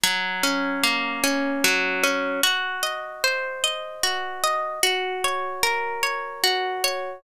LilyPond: \new Staff { \time 3/4 \key bes \minor \tempo 4 = 75 ges8 des'8 bes8 des'8 ges8 des'8 | ges'8 ees''8 c''8 ees''8 ges'8 ees''8 | ges'8 des''8 bes'8 des''8 ges'8 des''8 | }